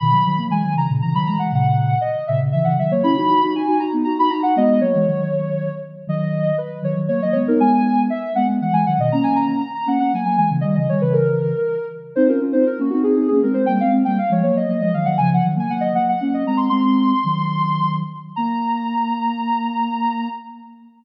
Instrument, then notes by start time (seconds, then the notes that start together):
ocarina
0.00 B2 D#3 B5
0.11 D#3 F#3
0.26 D#3 F#3
0.38 F#3 A#3
0.50 E3 G#3 G#5
0.63 D#3 F#3
0.75 C#3 E3 A#5
0.89 A#2 C#3
1.02 C#3 E3 A#5
1.14 D#3 F#3 B5
1.26 E3 G#3 A#5
1.38 E3 G#3 F#5
1.52 A#2 C#3 F#5
2.01 D#5
2.27 A#2 C#3 E5
2.40 A#2 C#3
2.52 C#3 E3 E5
2.64 C#3 E3 F#5
2.78 D#3 F#3 E5
2.91 F#3 A#3 C#5
3.03 C#4 E4 B5
3.16 D#4 F#4
3.29 D#4 F#4
3.43 D#4 F#4
3.55 D#4 F#4 G#5
3.67 D#4 F#4
3.79 D#4 F#4 A#5
3.93 B3 D#4
4.04 D#4 F#4 A#5
4.18 D#4 F#4 B5
4.30 D#4 F#4 A#5
4.43 D#4 F#4 F#5
4.56 G#3 B3 D#5
4.81 F#3 A#3 C#5
4.94 E3 G#3
5.07 D#3 F#3
6.07 D#3 F#3 D#5
6.58 B4
6.82 D#3 F#3 C#5
6.96 D#3 F#3
7.08 F#3 A#3 C#5
7.22 F#3 A#3 D#5
7.32 G#3 B3 C#5
7.48 B3 D#4 A#4
7.60 G#3 B3 G#5
8.10 E5
8.35 G#3 B3 F#5
8.47 G#3 B3
8.61 E3 G#3 F#5
8.72 E3 G#3 G#5
8.86 D#3 F#3 F#5
8.98 B2 D#3 D#5
9.12 A#3 C#4 A#5
9.23 G#5
9.36 A#5
9.48 A#5
9.60 A#5
9.75 A#5
9.86 A#3 C#4 F#5
9.99 A#3 C#4 F#5
10.13 F#3 A#3 G#5
10.25 F#3 A#3 G#5
10.37 E3 G#3 G#5
10.50 C#3 E3
10.61 D#3 G3 D#5
10.75 C#3 E3 D#5
10.89 D#3 G3 C#5
11.01 C#3 E3 B4
11.13 A#4
12.16 C4 D#4 C5
12.27 C#4 F4 A#4
12.41 C#4 F4
12.52 C4 D#4 C5
12.67 A#4
12.79 A#3 C#4 F#4
12.90 C4 D#4 F#4
13.03 C4 D#4 G#4
13.16 C4 D#4 G#4
13.28 A#3 C#4 G#4
13.42 G#3 C4 A#4
13.53 G#3 C4 C5
13.66 G3 A#3 G5
13.80 G#3 C4 F5
13.91 G#3 C4
14.05 G3 A#3 G5
14.18 F5
14.30 F3 G#3 C#5
14.42 F#3 A#3 C#5
14.55 F#3 A#3 D#5
14.68 F#3 A#3 D#5
14.80 F3 G#3 D#5
14.94 D#3 F#3 F5
15.05 D#3 F#3 F#5
15.18 C#3 F3 G#5
15.34 F#5
15.45 D#3 F#3
15.56 F#3 A#3 G#5
15.70 F#3 A#3 F#5
15.81 D#5
15.94 F#3 A#3 F#5
16.09 F#5
16.20 A#3 C#4 F#5
16.34 D#5
16.46 G#3 C4 A#5
16.57 C6
16.70 G#3 C4 C6
17.24 D#3 F#3
18.36 A#3 A#5